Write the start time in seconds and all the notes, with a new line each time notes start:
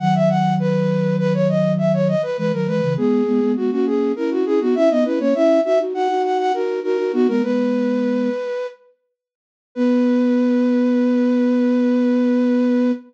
0.00 D#3 F#3 F#5
0.15 E5
0.29 F#5
0.60 B4
1.19 B4
1.34 C#5
1.49 D#5
1.78 E5
1.93 C#5
2.08 D#5
2.23 B4
2.38 E3 G#3 B4
2.53 D#3 F#3 A#4
2.67 E3 G#3 B4
2.83 C#3 E3
2.97 G#3 B3 G#4
3.27 G#3 B3
3.42 G#3 B3
3.56 G#3 B3 F#4
3.71 A#3 C#4 F#4
3.86 G#4
4.16 C#4 E4 A#4
4.31 F#4
4.45 C#4 E4 G#4
4.61 B3 D#4 F#4
4.75 C#4 E4 E5
4.90 B3 D#4 D#5
5.05 C#4 E4 B4
5.20 A#3 C#4 C#5
5.35 C#4 E4 E5
5.65 D#4 F#4 E5
5.79 D#4 F#4
5.94 D#4 F#4 F#5
6.09 D#4 F#4
6.24 F#5
6.38 F#5
6.54 D#4 F#4 A#4
6.83 D#4 F#4 A#4
6.98 D#4 F#4
7.13 B3 D#4 F#4
7.28 G#3 B3 A#4
7.43 G#3 B3 B4
9.75 B3 B4